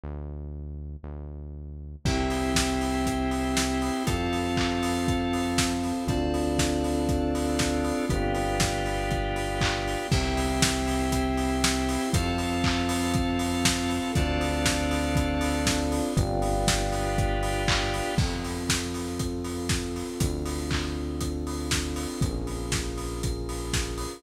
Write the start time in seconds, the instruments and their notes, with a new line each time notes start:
0.03 synth bass 1 D2
1.03 synth bass 1 D2
2.04 synth bass 1 C2, pad 2 (warm) C4 E4 G4, drawbar organ C4 E4 G4, electric piano 2 C5 E5 G5, kick, crash
2.30 open hi-hat
2.55 kick, snare
2.81 open hi-hat
3.06 kick, closed hi-hat
3.31 open hi-hat
3.57 snare
3.82 open hi-hat
4.07 synth bass 1 F2, drawbar organ C4 F4 A4, pad 2 (warm) C4 F4 A4, electric piano 2 C5 F5 A5, kick, closed hi-hat
4.33 open hi-hat
4.57 kick, clap
4.83 open hi-hat
5.08 kick, closed hi-hat
5.33 open hi-hat
5.58 kick, snare
5.84 open hi-hat
6.07 synth bass 1 D2, drawbar organ C4 D4 F4 A4, pad 2 (warm) C4 D4 F4 A4, electric piano 2 C5 D5 F5 A5, kick, closed hi-hat
6.34 open hi-hat
6.59 kick, snare
6.84 open hi-hat
7.09 kick, closed hi-hat
7.35 open hi-hat
7.59 kick, snare
7.84 open hi-hat
8.09 synth bass 1 G1, drawbar organ B3 D4 F4 G4, electric piano 2 B4 D5 F5 G5, kick, closed hi-hat
8.35 open hi-hat
8.60 kick, snare
8.86 open hi-hat
9.11 kick, closed hi-hat
9.36 open hi-hat
9.61 kick, clap
9.88 open hi-hat
10.11 synth bass 1 C2, drawbar organ C4 E4 G4, pad 2 (warm) C4 E4 G4, electric piano 2 C5 E5 G5, kick, crash
10.37 open hi-hat
10.62 kick, snare
10.88 open hi-hat
11.12 kick, closed hi-hat
11.37 open hi-hat
11.64 snare
11.89 open hi-hat
12.13 synth bass 1 F2, drawbar organ C4 F4 A4, pad 2 (warm) C4 F4 A4, electric piano 2 C5 F5 A5, kick, closed hi-hat
12.38 open hi-hat
12.64 kick, clap
12.89 open hi-hat
13.14 kick, closed hi-hat
13.39 open hi-hat
13.65 kick, snare
13.90 open hi-hat
14.15 synth bass 1 D2, pad 2 (warm) C4 D4 F4 A4, drawbar organ C4 D4 F4 A4, electric piano 2 C5 D5 F5 A5, kick, closed hi-hat
14.41 open hi-hat
14.65 kick, snare
14.91 open hi-hat
15.16 kick, closed hi-hat
15.41 open hi-hat
15.66 kick, snare
15.92 open hi-hat
16.17 synth bass 1 G1, drawbar organ B3 D4 F4 G4, electric piano 2 B4 D5 F5 G5, kick, closed hi-hat
16.42 open hi-hat
16.67 kick, snare
16.92 open hi-hat
17.18 kick, closed hi-hat
17.43 open hi-hat
17.68 kick, clap
17.94 open hi-hat
18.18 synth bass 1 F2, pad 2 (warm) C4 F4 A4, kick, crash
18.44 open hi-hat
18.69 kick, snare
18.94 open hi-hat
19.19 kick, closed hi-hat
19.44 open hi-hat
19.69 kick, snare
19.96 open hi-hat
20.19 synth bass 1 D2, pad 2 (warm) C4 D4 F4 A4, kick, closed hi-hat
20.45 open hi-hat
20.71 kick, clap
21.21 kick, closed hi-hat
21.47 open hi-hat
21.71 kick, snare
21.96 open hi-hat
22.21 synth bass 1 A#1, pad 2 (warm) C#4 F4 G#4 A#4, kick, closed hi-hat
22.47 open hi-hat
22.72 kick, snare
22.98 open hi-hat
23.23 kick, closed hi-hat
23.49 open hi-hat
23.73 kick, snare
23.98 open hi-hat